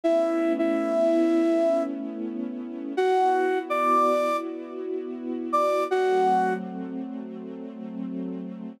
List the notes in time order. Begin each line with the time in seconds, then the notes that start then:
0.04 A3 B3 C#4 E4 E5
0.59 E4 E5
2.96 B3 E4 F#4 F#5
3.70 D5 D6
5.53 D5 D6
5.89 F#3 A3 C4 F#4 F#5